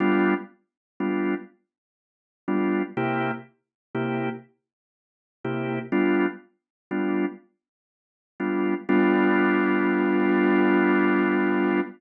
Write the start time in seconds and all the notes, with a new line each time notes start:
0.00 G3 B3 D4 F4
1.00 G3 B3 D4 F4
2.48 G3 B3 D4 F4
2.97 C3 A#3 E4 G4
3.94 C3 A#3 E4 G4
5.44 C3 A#3 E4 G4
5.92 G3 B3 D4 F4
6.91 G3 B3 D4 F4
8.40 G3 B3 D4 F4
8.88 G3 B3 D4 F4